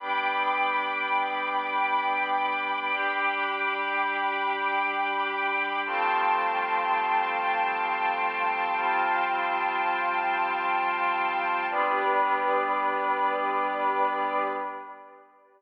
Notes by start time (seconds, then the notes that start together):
0.00 G3 B3 D4 G5 B5 D6
2.93 G3 D4 G4
5.86 F3 G3 A3 C4 F5 G5 A5 C6
8.78 F3 G3 C4 F4
11.69 G3 B3 D4 G4 B4 D5